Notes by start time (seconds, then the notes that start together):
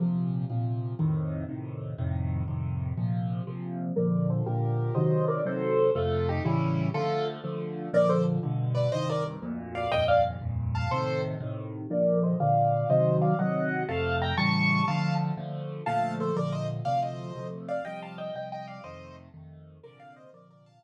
0.00 A#2 C3 F3
0.50 A#2 C3 F3
0.99 F2 A2 C3 D#3
1.49 F2 A2 C3 D#3
1.98 F2 A2 C3 D#3
2.48 F2 A2 C3 D#3
2.97 A#2 C3 F3
3.47 A#2 C3 F3
3.96 A#2 D3 F3 A#4 D5
4.30 A4 C5
4.46 A#2 D3 F3 G4 A#4
4.95 C3 D#3 F#3 C5 D#5
5.28 A#4 D5
5.45 C3 D#3 F#3 A4 C5
5.95 F2 C3 A3 F4 A4
6.29 D#4 G4
6.45 A2 C#3 E3 G3 C#4 E4
6.94 D3 F3 A3 F4 A4
7.44 D3 F3 A3
7.93 A#2 D3 F3 A#4 D5
8.09 A4 C5
8.43 G2 B2 D3
8.75 B4 D5
8.92 C2 G2 D#3 C5 D#5
9.10 A#4 D5
9.42 D2 F2 A#2
9.75 D5 F5
9.92 D#2 F2 G2 A#2 D#5 G5
10.08 D5 F5
10.41 D#2 F2 G2 A#2
10.75 F5 A5
10.91 A2 C3 D#3 A4 C5
11.40 A2 C3 D#3
11.90 A#2 D3 F3 A#4 D5
12.23 C5 D#5
12.40 A#2 D3 F3 D5 F5
12.89 C3 D#3 F#3 C5 D#5
13.22 D5 F5
13.39 C3 D#3 F#3 D#5 F#5
13.88 F2 C3 A3 F5 A5
14.22 G5 A#5
14.37 A2 C#3 E3 G3 A5 C#6
14.88 D3 F3 A3 F5 A5
15.37 D3 F3 A3
15.86 A#2 D3 F3 A3 F5 A5
16.20 A4 C5
16.36 A#2 D3 F3 A3 A#4 D5
16.52 C5 D#5
16.85 D2 C3 F3 A3 D5 F5
17.02 C5 D#5
17.35 D2 C3 F3 A3
17.69 D5 F5
17.85 C3 F3 G3 D#5 G5
18.02 F5 A5
18.18 D#5 G5
18.35 C3 F3 G3 D#5 G5
18.52 D#5 G5
18.67 D5 F5
18.84 F2 C3 D#3 A3 C5 D#5
19.34 F2 C3 D#3 A3
19.83 A#2 C3 D3 F3 A#4 D5
20.00 D5 F5
20.16 C5 D#5
20.33 A#2 C3 D3 F3 A#4 D5
20.51 A#4 D5
20.66 F5 A5
20.83 A#2 C3 D3 F3